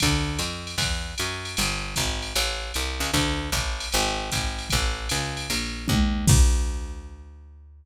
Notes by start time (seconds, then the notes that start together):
0.00 D2, kick, ride
0.39 F2, hi-hat pedal, ride
0.67 ride
0.78 E2, kick, ride
1.18 F#2, hi-hat pedal, ride
1.45 ride
1.57 G1, ride
1.96 G#1, kick, hi-hat pedal, ride
2.22 ride
2.35 A1, ride
2.74 C2, hi-hat pedal, ride
3.00 C#2, ride
3.13 D2, kick, ride
3.52 A1, kick, hi-hat pedal, ride
3.80 ride
3.92 G#1, ride
4.32 G#1, kick, hi-hat pedal, ride
4.59 ride
4.70 A1, kick, ride
5.09 C#2, hi-hat pedal, ride
5.37 ride
5.50 A#1, ride
5.88 D#2, kick, high tom
6.27 D2, kick, crash